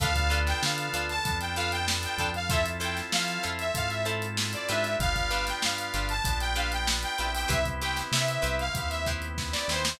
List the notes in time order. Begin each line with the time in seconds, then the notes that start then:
0.00 D2 B3 D4 F4 A4 B4 F5, kick, closed hi-hat
0.15 kick, closed hi-hat
0.30 D4 F4 A4 B4, closed hi-hat
0.47 G5, snare, closed hi-hat
0.62 D3 F5, snare
0.78 closed hi-hat
0.93 D2 D4 F4 A4 B4, closed hi-hat
1.09 A5, snare, closed hi-hat
1.24 F2 B3 D4 F4 A4, kick, closed hi-hat
1.40 G5, closed hi-hat
1.56 D4 F4 A4 B4 F5, closed hi-hat
1.72 G5, closed hi-hat
1.88 snare
2.03 G5, closed hi-hat
2.18 F2 D4 F4 A4 B4, kick, closed hi-hat
2.34 F5, closed hi-hat
2.49 C4 E4 F4 A4 C5 E5, kick, closed hi-hat
2.65 snare, closed hi-hat
2.80 E4 F4 A4 C5 G5, closed hi-hat
2.97 snare, closed hi-hat
3.12 F3 F5, snare
3.28 closed hi-hat
3.43 F2 E4 F4 A4 C5, closed hi-hat
3.59 E5, closed hi-hat
3.74 G#2 C4 E4 F4 A4 F5, kick, closed hi-hat
3.90 E5, closed hi-hat
4.05 E4 F4 A4 C5, closed hi-hat
4.22 closed hi-hat
4.37 snare
4.53 D5, closed hi-hat
4.68 G#2 D4 F4 G4 B4 E5, snare, closed hi-hat
4.84 closed hi-hat
4.99 G1 B3 D4 F4 G4 F5, kick, closed hi-hat
5.16 kick, closed hi-hat
5.30 D4 F4 G4 B4, closed hi-hat
5.47 G5, snare, closed hi-hat
5.62 G2 F5, snare
5.78 closed hi-hat
5.94 G1 D4 F4 G4 B4, closed hi-hat
6.09 A5, closed hi-hat
6.24 A#1 B3 D4 F4 G4, kick, closed hi-hat
6.40 G5, snare, closed hi-hat
6.56 D4 F4 G4 B4 F5, closed hi-hat
6.72 G5, closed hi-hat
6.87 snare
7.03 G5, closed hi-hat
7.18 A#1 B3 C4 D4 E4 F4 G4 B4, closed hi-hat
7.35 G5, open hi-hat
7.48 C2 E4 G4 B4 C5 E5, kick, closed hi-hat
7.65 kick, closed hi-hat
7.81 E4 G4 B4 C5 G5, closed hi-hat
7.96 snare, closed hi-hat
8.12 C3 E5, snare
8.28 closed hi-hat
8.42 C2 E4 G4 B4 C5, closed hi-hat
8.59 F5, closed hi-hat
8.75 D#2 B3 C4 E4 G4 F5, kick, closed hi-hat
8.90 E5, snare, closed hi-hat
9.06 E4 G4 B4 C5, kick, snare, closed hi-hat
9.22 closed hi-hat
9.38 kick, snare
9.52 D5, snare
9.68 D#2 E4 G4 B4 C5, snare
9.85 snare